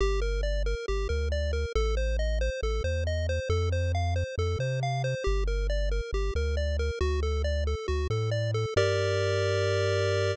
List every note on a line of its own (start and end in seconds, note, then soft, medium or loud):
0.01 0.75 G1 loud
0.01 0.20 G4 medium
0.22 0.41 A#4 medium
0.43 0.63 D5 medium
0.66 0.86 A#4 medium
0.88 1.08 G1 medium
0.88 1.08 G4 medium
1.09 1.66 D2 loud
1.09 1.29 A#4 medium
1.32 1.52 D5 medium
1.53 1.73 A#4 medium
1.75 2.50 A1 loud
1.75 1.95 A4 medium
1.97 2.17 C5 medium
2.19 2.39 D#5 medium
2.41 2.61 C5 medium
2.62 2.81 A1 loud
2.62 2.83 A4 medium
2.84 3.40 E2 loud
2.84 3.04 C5 medium
3.07 3.27 D#5 medium
3.29 3.49 C5 medium
3.49 4.24 F2 loud
3.49 3.69 A4 medium
3.72 3.92 C5 medium
3.95 4.14 F5 medium
4.16 4.35 C5 medium
4.38 4.56 F2 loud
4.38 4.58 A4 medium
4.59 5.15 C3 loud
4.59 4.80 C5 medium
4.83 5.02 F5 medium
5.04 5.24 C5 medium
5.24 6.01 G1 loud
5.24 5.44 G4 medium
5.47 5.67 A#4 medium
5.70 5.89 D5 medium
5.91 6.11 A#4 medium
6.13 6.31 G1 loud
6.13 6.34 G4 medium
6.35 6.91 D2 loud
6.35 6.56 A#4 medium
6.57 6.77 D5 medium
6.79 6.99 A#4 medium
7.01 7.75 D2 loud
7.01 7.20 F#4 medium
7.23 7.42 A4 medium
7.44 7.64 D5 medium
7.67 7.87 A4 medium
7.88 8.07 D2 loud
7.88 8.07 F#4 medium
8.10 8.66 A2 loud
8.10 8.30 A4 medium
8.31 8.51 D5 medium
8.54 8.74 A4 medium
8.76 10.35 G2 loud
8.76 10.35 G4 loud
8.76 10.35 A#4 loud
8.76 10.35 D5 loud